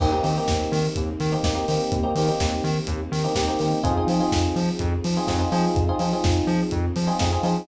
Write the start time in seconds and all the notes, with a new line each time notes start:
0.00 D#2 A#3 C4 D#4 G4, kick, crash
0.12 A#3 C4 D#4 G4
0.23 D#3 A#3 C4 D#4 G4, open hi-hat
0.38 A#3 C4 D#4 G4
0.48 D#2, kick, snare
0.72 D#3, open hi-hat
0.96 D#2, kick, closed hi-hat
1.20 D#3, open hi-hat
1.32 A#3 C4 D#4 G4
1.43 D#2 A#3 C4 D#4 G4, kick, snare
1.55 A#3 C4 D#4 G4
1.68 D#3 A#3 C4 D#4 G4, open hi-hat
1.92 D#2, kick, closed hi-hat
2.03 A#3 C4 D#4 G4
2.15 D#3 A#3 C4 D#4 G4, open hi-hat
2.28 A#3 C4 D#4 G4
2.40 D#2, kick, snare
2.64 D#3, open hi-hat
2.87 D#2, kick, closed hi-hat
3.12 D#3, open hi-hat
3.24 A#3 C4 D#4 G4
3.35 D#2 A#3 C4 D#4 G4, kick, snare
3.48 A#3 C4 D#4 G4
3.59 D#3 A#3 C4 D#4 G4, open hi-hat
3.83 F2 C4 D#4 F4 G#4, kick, closed hi-hat
3.97 C4 D#4 F4 G#4
4.07 F3 C4 D#4 F4 G#4, open hi-hat
4.20 C4 D#4 F4 G#4
4.32 F2, kick, snare
4.56 F3, open hi-hat
4.79 F2, kick, closed hi-hat
5.04 F3, open hi-hat
5.17 C4 D#4 F4 G#4
5.27 F2 C4 D#4 F4 G#4, kick, snare
5.39 C4 D#4 F4 G#4
5.52 F3 C4 D#4 F4 G#4, open hi-hat
5.75 F2, kick, closed hi-hat
5.89 C4 D#4 F4 G#4
5.99 F3 C4 D#4 F4 G#4, open hi-hat
6.13 C4 D#4 F4 G#4
6.24 F2, kick, snare
6.47 F3, open hi-hat
6.71 F2, kick, closed hi-hat
6.96 F3, open hi-hat
7.07 C4 D#4 F4 G#4
7.19 F2 C4 D#4 F4 G#4, kick, snare
7.32 C4 D#4 F4 G#4
7.43 F3 C4 D#4 F4 G#4, open hi-hat